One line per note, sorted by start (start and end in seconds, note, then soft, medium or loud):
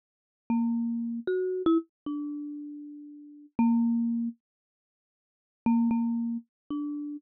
0.50 1.20 A#3 medium
1.27 1.62 F#4 medium
1.66 1.78 E4 loud
2.06 3.46 D4 medium
3.59 4.29 A#3 loud
5.66 5.89 A#3 loud
5.91 6.37 A#3 medium
6.70 7.17 D4 medium